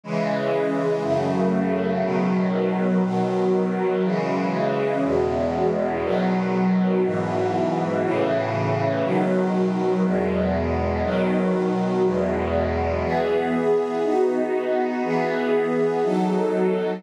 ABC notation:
X:1
M:4/4
L:1/8
Q:1/4=60
K:E
V:1 name="String Ensemble 1"
[C,E,G,]2 | [F,,C,A,]2 [B,,D,F,]2 [B,,D,F,]2 [C,E,G,]2 | [E,,B,,G,]2 [B,,D,F,]2 [G,,B,,E,]2 [A,,C,E,]2 | [B,,D,F,]2 [E,,B,,G,]2 [B,,D,F,]2 [E,,B,,G,]2 |
[E,B,G]2 [B,DF]2 [E,B,G]2 [F,DA]2 |]